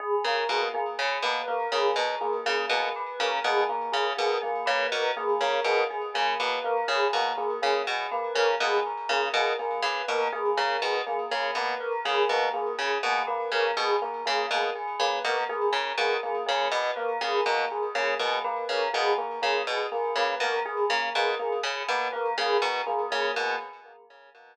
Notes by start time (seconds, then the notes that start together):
0.00 G#4
0.24 C#3 A#3 A#4
0.49 B2 A#3 G#4
0.74 A#3 G#4
0.99 C#3 G#4
1.22 B2 A#3 B4
1.48 A#3 A#4
1.72 C#3 A#3 G#4
1.96 B2 A#4
2.21 A#3 G#4
2.46 C#3 A#3 G#4
2.69 B2 A#3 G#4
2.96 B4
3.20 C#3 A#3 A#4
3.44 B2 A#3 G#4
3.69 A#3 A#4
3.92 C#3 G#4
4.17 B2 A#3 G#4
4.42 A#3 G#4
4.66 C#3 A#3 B4
4.92 B2 A#4
5.16 A#3 G#4
5.41 C#3 A#3 A#4
5.64 B2 A#3 G#4
5.90 G#4
6.14 C#3 A#3 G#4
6.39 B2 A#3 B4
6.64 A#3 A#4
6.88 C#3 G#4
7.13 B2 A#3 A#4
7.37 A#3 G#4
7.62 C#3 A#3 G#4
7.87 B2 G#4
8.11 A#3 B4
8.35 C#3 A#3 A#4
8.60 B2 A#3 G#4
8.86 A#4
9.09 C#3 A#3 G#4
9.33 B2 A#3 G#4
9.59 A#3 G#4
9.82 C#3 B4
10.08 B2 A#3 A#4
10.33 A#3 G#4
10.57 C#3 A#3 A#4
10.82 B2 G#4
11.06 A#3 G#4
11.31 C#3 A#3 G#4
11.55 B2 A#3 B4
11.80 A#4
12.05 C#3 A#3 G#4
12.29 B2 A#3 A#4
12.53 A#3 G#4
12.79 C#3 G#4
13.03 B2 A#3 G#4
13.27 A#3 B4
13.52 C#3 A#3 A#4
13.77 B2 G#4
14.02 A#3 A#4
14.26 C#3 A#3 G#4
14.51 B2 A#3 G#4
14.75 G#4
15.00 C#3 A#3 B4
15.24 B2 A#3 A#4
15.49 A#3 G#4
15.73 C#3 A#4
15.98 B2 A#3 G#4
16.23 A#3 G#4
16.46 C#3 A#3 G#4
16.72 B2 B4
16.96 A#3 A#4
17.21 C#3 A#3 G#4
17.46 B2 A#3 A#4
17.71 G#4
17.95 C#3 A#3 G#4
18.19 B2 A#3 G#4
18.44 A#3 B4
18.69 C#3 A#4
18.93 B2 A#3 G#4
19.18 A#3 A#4
19.42 C#3 A#3 G#4
19.67 B2 G#4
19.92 A#3 G#4
20.16 C#3 A#3 B4
20.40 B2 A#3 A#4
20.65 G#4
20.90 C#3 A#3 A#4
21.15 B2 A#3 G#4
21.39 A#3 G#4
21.63 C#3 G#4
21.88 B2 A#3 B4
22.12 A#3 A#4
22.38 C#3 A#3 G#4
22.62 B2 A#4
22.86 A#3 G#4
23.11 C#3 A#3 G#4
23.35 B2 A#3 G#4